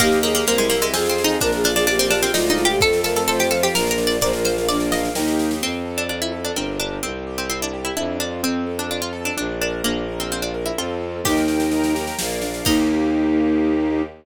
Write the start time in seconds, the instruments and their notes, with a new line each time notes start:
0.00 violin D#2, harpsichord A#3, string ensemble 1 A#3 D#4 G4, flute G4, acoustic grand piano A#4 D#5 G5, kick, snare, crash
0.12 snare
0.23 harpsichord A#3, flute G#4, snare
0.35 harpsichord A#3, snare
0.46 violin C2, harpsichord A#3, string ensemble 1 C4 E4 G4, flute A#4, acoustic grand piano C5, snare
0.58 harpsichord G#3, snare
0.70 harpsichord A#3, acoustic grand piano E5, snare
0.81 harpsichord G#3, snare
0.93 violin F2, string ensemble 1 C4 F4 G#4, harpsichord C4, flute G#4, acoustic grand piano C5 F5 G#5, snare
1.06 harpsichord C4, snare
1.18 snare
1.24 harpsichord D#4, snare
1.40 violin A#1, string ensemble 1 A#3 D4 F4, harpsichord D4, flute A#4, acoustic grand piano A#4, kick, snare
1.52 flute G#4, snare
1.64 harpsichord D4, acoustic grand piano F5, snare
1.75 harpsichord D4, flute G#4, snare
1.87 string ensemble 1 A#3 F4 A#4, harpsichord D4, flute G4, acoustic grand piano D5, snare
1.99 harpsichord C4, snare
2.10 harpsichord D4, acoustic grand piano F5, snare
2.22 harpsichord C4, snare
2.33 violin D2, string ensemble 1 G#3 D4 F4, harpsichord D#4, flute F4, acoustic grand piano G#4 D5 F5, snare
2.46 harpsichord D#4, snare
2.58 flute F4, snare
2.65 harpsichord G4
2.69 flute G4, snare
2.80 violin F2, string ensemble 1 A3 C4 F4, acoustic grand piano A4, flute A4, harpsichord A4, kick, snare
2.93 snare
3.04 harpsichord A4, flute A#4, acoustic grand piano F5, snare
3.16 harpsichord A4, snare
3.27 string ensemble 1 F3 A3 F4, harpsichord A4, flute C5, acoustic grand piano C5, snare
3.39 harpsichord G4, snare
3.51 harpsichord A4, acoustic grand piano F5, snare
3.63 harpsichord G4, snare
3.74 violin A#1, string ensemble 1 A#3 D4 F4, acoustic grand piano A#4, flute A#4, harpsichord A#4, snare
3.87 harpsichord A#4, snare
3.98 acoustic grand piano D5, snare
4.07 harpsichord D5, snare
4.20 violin A#1, string ensemble 1 A#3 D4 F4, acoustic grand piano A#4, flute C5, harpsichord D5, kick, snare
4.33 flute A#4, snare
4.45 harpsichord C5, acoustic grand piano F5, snare
4.57 flute A#4, snare
4.68 string ensemble 1 A#3 F4 A#4, flute D4, harpsichord D5, acoustic grand piano D5, snare
4.80 snare
4.91 harpsichord D#5, acoustic grand piano F5, snare
5.05 snare
5.15 violin D#2, string ensemble 1 A#3 D#4 G4, flute D#4, acoustic grand piano A#4 D#5 G5, snare
5.28 snare
5.39 snare
5.51 snare
5.62 violin F2, acoustic grand piano C4, harpsichord C4
5.85 acoustic grand piano A4
5.98 harpsichord D4
6.09 harpsichord D4, acoustic grand piano F4
6.22 harpsichord E4
6.32 acoustic grand piano A4
6.45 harpsichord D4
6.56 violin G1, harpsichord C4, acoustic grand piano D4 G4 A#4
6.80 harpsichord D4
7.03 violin C2, harpsichord C4, acoustic grand piano C4
7.27 acoustic grand piano G4
7.38 harpsichord C4
7.50 harpsichord C4, acoustic grand piano E4
7.62 harpsichord D4
7.73 acoustic grand piano G4
7.85 harpsichord E4
7.97 violin F2, acoustic grand piano D4, harpsichord E4
8.20 harpsichord D4, acoustic grand piano F4
8.43 violin F2, acoustic grand piano C4, harpsichord C4
8.67 acoustic grand piano A4
8.79 harpsichord D4
8.91 harpsichord D4, acoustic grand piano F4
9.02 harpsichord F4
9.13 acoustic grand piano A4
9.25 harpsichord D4
9.37 violin A#1, acoustic grand piano D4, harpsichord D4
9.61 harpsichord D4, acoustic grand piano A#4
9.84 violin A#1, harpsichord A#3, acoustic grand piano D4
10.08 acoustic grand piano A#4
10.20 harpsichord C4
10.30 harpsichord C4, acoustic grand piano F4
10.42 harpsichord D4
10.54 acoustic grand piano A#4
10.66 harpsichord E4
10.78 violin F2, acoustic grand piano C4 F4 A4, harpsichord F4
11.24 violin D#2, acoustic grand piano A#3, flute D#4, harpsichord G4, string ensemble 1 A#4 D#5 G5, kick, snare, crash
11.37 snare
11.48 acoustic grand piano G4, snare
11.60 snare
11.71 acoustic grand piano D#4, string ensemble 1 A#4 G5 A#5, snare
11.84 snare
11.95 acoustic grand piano G4, snare
12.07 snare
12.18 violin A#1, acoustic grand piano A#3, string ensemble 1 A#4 D5 F5, snare
12.31 snare
12.42 acoustic grand piano D4, snare
12.54 snare
12.64 violin D#2, string ensemble 1 A#3 D#4 G4, acoustic grand piano A#3 D#4 G4, flute D#4, harpsichord D#4, kick, crash